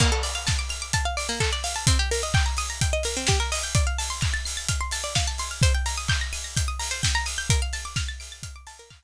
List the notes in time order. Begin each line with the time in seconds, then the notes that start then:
0.00 A#3, kick, crash
0.12 A4
0.23 D5, open hi-hat
0.35 F5
0.47 A5, kick, snare
0.59 D6
0.69 F6, open hi-hat
0.82 D6
0.93 A5, kick, closed hi-hat
1.05 F5
1.17 D5, open hi-hat
1.29 A#3
1.40 A4, kick, clap
1.53 D5
1.64 F5, open hi-hat
1.76 A5
1.87 C4, kick, closed hi-hat
1.99 G4
2.11 A#4, open hi-hat
2.23 D#5
2.34 G5, kick, clap
2.46 A#5
2.57 D#6, open hi-hat
2.70 A#5
2.81 G5, kick, closed hi-hat
2.93 D#5
3.03 A#4, open hi-hat
3.17 C4
3.27 G4, kick, snare
3.40 A#4
3.52 D#5, open hi-hat
3.63 G5
3.75 D5, kick, closed hi-hat
3.87 F5
3.98 A5, open hi-hat
4.10 C6
4.21 F6, kick, clap
4.34 A6
4.45 C7, open hi-hat
4.57 A6
4.68 F6, kick, closed hi-hat
4.81 C6
4.91 A5, open hi-hat
5.04 D5
5.15 F5, kick, snare
5.27 A5
5.38 C6, open hi-hat
5.51 F6
5.62 C5, kick, closed hi-hat
5.75 G5
5.86 A#5, open hi-hat
5.97 D#6
6.08 G6, kick, clap
6.21 A#6
6.33 D#7, open hi-hat
6.44 A#6
6.57 G6, kick, closed hi-hat
6.68 D#6
6.79 A#5, open hi-hat
6.91 C5
7.03 G5, kick, snare
7.15 A#5
7.26 D#6, open hi-hat
7.38 G6
7.50 A#4, kick, closed hi-hat
7.62 F5
7.73 A5, open hi-hat
7.85 D6
7.96 F6, kick, snare
8.08 A6
8.20 D7, open hi-hat
8.32 A6
8.43 F6, kick, closed hi-hat
8.56 D6
8.67 A5, open hi-hat
8.79 A#4
8.90 F5, kick, clap
9.03 A5